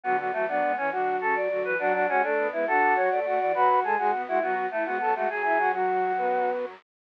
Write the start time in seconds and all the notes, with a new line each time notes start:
0.03 D2 D3 F#3 B3 F#4
0.19 F#3 B3 F#4
0.33 E2 E3 F#3 A3 F#4
0.48 F#2 F#3 B3 D4 D5
0.63 G#2 G#3
0.77 E2 E3 C#4 C#5
0.92 D3 F#3 D4 F#4
1.21 C#3 C#4 A4
1.36 F#2 F#3 D5
1.50 D2 D3 F#3 F#4
1.65 E2 E3 B4
1.79 F#2 F#3 D4 F#4 F#5
1.94 D4 F#4 F#5
2.08 G#2 G#3 C#4 F#4 F#5
2.23 A2 A3 D4 A4
2.37 B2 B3
2.52 G#2 G#3 B3 E4 B4
2.67 D3 D4 F#4 A4 F#5
2.95 F#3 F#4 C#5
3.11 A2 A3 D5
3.25 A2 A3 F#4 F#5
3.40 E2 E3 D5
3.54 F#2 F#3 F#4 B4 B5
3.69 F#4
3.83 G#2 G#3 G#4 A4 A5
3.98 G#2 G#3 F#4 G#4 G#5
4.13 B2 B3
4.27 G#2 G#3 E4 F#4 F#5
4.42 F#3 B3 F#4
4.71 E3 A3 E4
4.85 G#2 G#3 B3 F#4 F#5
5.01 F#2 F#3 A4 A5
5.15 G#2 G#3 A3 F#4 F#5
5.30 F#2 F#3 G#4 G#5
5.44 E4 E5
5.59 F#4 F#5
5.73 F#3 F#4
6.17 B3 B4